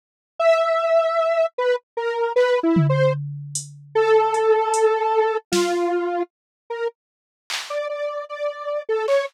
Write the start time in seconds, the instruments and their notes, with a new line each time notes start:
0.39 lead 1 (square) E5
1.58 lead 1 (square) B4
1.97 lead 1 (square) A#4
2.36 lead 1 (square) B4, clap
2.63 lead 1 (square) E4
2.76 floor tom
2.89 lead 1 (square) C5
3.55 closed hi-hat
3.95 lead 1 (square) A4
4.34 closed hi-hat
4.74 closed hi-hat
5.52 lead 1 (square) F4, snare
6.70 lead 1 (square) A#4
7.50 clap
7.70 lead 1 (square) D5
7.89 lead 1 (square) D5
8.29 lead 1 (square) D5
8.89 lead 1 (square) A4
9.08 lead 1 (square) C#5, clap